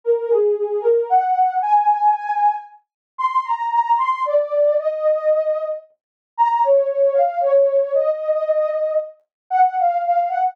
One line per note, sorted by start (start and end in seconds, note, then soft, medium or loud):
0.04 0.29 A#4 medium
0.29 0.54 G#4 medium
0.56 0.81 G#4 medium
0.81 1.06 A#4 medium
1.09 1.53 F#5 medium
1.62 2.52 G#5 medium
3.18 3.43 C6 medium
3.45 3.70 A#5 medium
3.72 3.97 A#5 medium
3.97 4.22 C6 medium
4.25 4.77 D5 medium
4.78 5.64 D#5 medium
6.38 6.63 A#5 medium
6.63 6.88 C#5 medium
6.89 7.14 C#5 medium
7.14 7.39 F5 medium
7.41 7.91 C#5 medium
7.94 8.94 D#5 medium
9.50 9.75 F#5 medium
9.79 10.03 F5 medium
10.04 10.29 F5 medium
10.28 10.53 F#5 medium